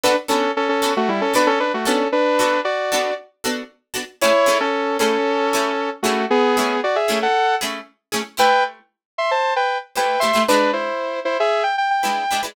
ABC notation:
X:1
M:4/4
L:1/16
Q:1/4=115
K:Bm
V:1 name="Lead 2 (sawtooth)"
[DB] z [CA]2 [CA] [CA]2 [A,F] [G,E] [CA] [DB] [CA] [DB] [A,F] [CA]2 | [DB]4 [Fd]4 z8 | [Ec]3 [CA]3 [CA]8 [A,F]2 | [B,^G]4 [Fd] [Ge]2 [Af]3 z6 |
[K:Am] [Bg]2 z4 [ec'] [ca]2 [Bg]2 z [Bg]2 [ec']2 | [DB]2 [Ec]4 [Ec] [^Ge]2 =g g g4 z |]
V:2 name="Pizzicato Strings"
[B,DFA]2 [B,DFA]4 [B,DFA]4 [B,DFA]4 [B,DFA]2- | [B,DFA]2 [B,DFA]4 [B,DFA]4 [B,DFA]4 [B,DFA]2 | [A,CE^G]2 [A,CEG]4 [A,CEG]4 [A,CEG]4 [A,CEG]2- | [A,CE^G]2 [A,CEG]4 [A,CEG]4 [A,CEG]4 [A,CEG]2 |
[K:Am] [A,EGc]12 [A,EGc]2 [A,EGc] [A,EGc] | [^G,DEB]12 [G,DEB]2 [G,DEB] [G,DEB] |]